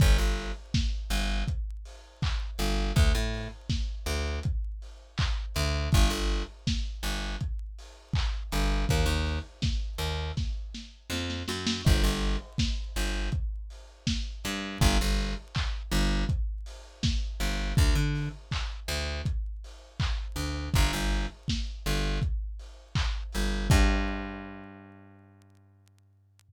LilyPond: <<
  \new Staff \with { instrumentName = "Electric Bass (finger)" } { \clef bass \time 4/4 \key g \minor \tempo 4 = 81 g,,16 g,,4~ g,,16 g,,2 g,,8 | d,16 a,4~ a,16 d,2 d,8 | g,,16 g,,4~ g,,16 g,,2 g,,8 | ees,16 ees,4~ ees,16 ees,4. f,8 fis,8 |
g,,16 g,,4~ g,,16 g,,2 g,8 | g,,16 g,,4~ g,,16 g,,2 g,,8 | d,16 d4~ d16 d,2 d,8 | g,,16 g,,4~ g,,16 g,,2 g,,8 |
g,1 | }
  \new DrumStaff \with { instrumentName = "Drums" } \drummode { \time 4/4 <hh bd>8 hho8 <bd sn>8 hho8 <hh bd>8 hho8 <hc bd>8 hho8 | <hh bd>8 hho8 <bd sn>8 hho8 <hh bd>8 hho8 <hc bd>8 hho8 | <hh bd>8 hho8 <bd sn>8 hho8 <hh bd>8 hho8 <hc bd>8 hho8 | <hh bd>8 hho8 <bd sn>8 hho8 <bd sn>8 sn8 sn16 sn16 sn16 sn16 |
<cymc bd>8 hho8 <bd sn>8 hho8 <hh bd>8 hho8 <bd sn>8 hho8 | <hh bd>8 hho8 <hc bd>8 hho8 <hh bd>8 hho8 <bd sn>8 hho8 | <hh bd>8 hho8 <hc bd>8 hho8 <hh bd>8 hho8 <hc bd>8 hho8 | <hh bd>8 hho8 <bd sn>8 hho8 <hh bd>8 hho8 <hc bd>8 hho8 |
<cymc bd>4 r4 r4 r4 | }
>>